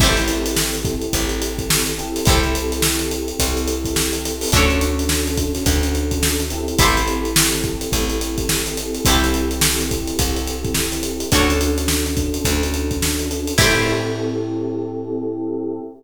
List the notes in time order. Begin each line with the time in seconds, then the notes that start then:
0.00 A1 C4 E4 G4 A4, kick, crash
0.04 C5
0.17 closed hi-hat
0.28 closed hi-hat
0.46 closed hi-hat
0.56 snare
0.74 closed hi-hat
0.85 kick, closed hi-hat
1.02 closed hi-hat
1.13 A1, kick, closed hi-hat
1.29 closed hi-hat
1.42 closed hi-hat
1.58 kick, closed hi-hat
1.70 snare
1.86 closed hi-hat
1.98 C4 E4 G4 A4, closed hi-hat
2.16 snare, closed hi-hat
2.25 C2 E4 G4 A4, kick, closed hi-hat
2.30 C5
2.43 closed hi-hat
2.55 closed hi-hat
2.72 closed hi-hat
2.82 snare
2.99 closed hi-hat
3.11 closed hi-hat
3.28 closed hi-hat
3.39 C2, kick, closed hi-hat
3.57 closed hi-hat
3.68 closed hi-hat
3.85 kick, closed hi-hat
3.96 snare
4.13 closed hi-hat
4.25 snare, closed hi-hat
4.41 open hi-hat
4.52 D2 C#4 D4 F#4 A4, kick, closed hi-hat
4.56 C#5
4.70 snare, closed hi-hat
4.81 closed hi-hat
4.99 closed hi-hat
5.09 snare
5.27 closed hi-hat
5.37 kick, closed hi-hat
5.55 snare, closed hi-hat
5.66 D2, kick, closed hi-hat
5.83 closed hi-hat
5.95 closed hi-hat
6.11 kick, closed hi-hat
6.23 snare
6.40 closed hi-hat
6.50 C4 E4 G4 A4, closed hi-hat
6.68 closed hi-hat
6.79 A1 E4 G4 A4, kick, closed hi-hat
6.83 C5
6.97 closed hi-hat
7.08 closed hi-hat
7.25 closed hi-hat
7.36 snare
7.52 snare, closed hi-hat
7.64 kick, closed hi-hat
7.81 closed hi-hat
7.92 A1, kick, closed hi-hat
8.10 closed hi-hat
8.21 closed hi-hat
8.38 kick, closed hi-hat
8.49 snare
8.66 closed hi-hat
8.77 closed hi-hat
8.95 closed hi-hat
9.05 C2 C4 E4 G4 A4, kick, closed hi-hat
9.09 A4 C5
9.23 snare, closed hi-hat
9.34 closed hi-hat
9.51 closed hi-hat
9.61 snare
9.80 closed hi-hat
9.91 kick, closed hi-hat
10.07 closed hi-hat
10.19 C2, kick, closed hi-hat
10.36 closed hi-hat
10.46 snare, closed hi-hat
10.65 kick, closed hi-hat
10.74 snare
10.92 closed hi-hat
11.03 closed hi-hat
11.20 closed hi-hat
11.32 D2 C#4 D4 F#4 A4 C#5, kick, closed hi-hat
11.50 closed hi-hat
11.61 closed hi-hat
11.78 closed hi-hat
11.88 snare
12.06 snare, closed hi-hat
12.17 kick, closed hi-hat
12.34 closed hi-hat
12.45 D2, kick, closed hi-hat
12.63 closed hi-hat
12.74 closed hi-hat
12.91 kick, closed hi-hat
13.02 snare
13.19 closed hi-hat
13.31 closed hi-hat
13.47 closed hi-hat
13.58 A2 C4 E4 G4 A4 C5, kick, crash